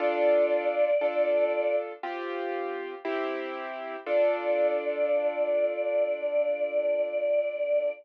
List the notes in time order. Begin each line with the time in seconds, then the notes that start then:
0.00 D4 F4 A4 D5
1.01 D4 F4 A4
2.03 C4 F4 G4
3.05 C4 E4 G4
4.06 D4 F4 A4 D5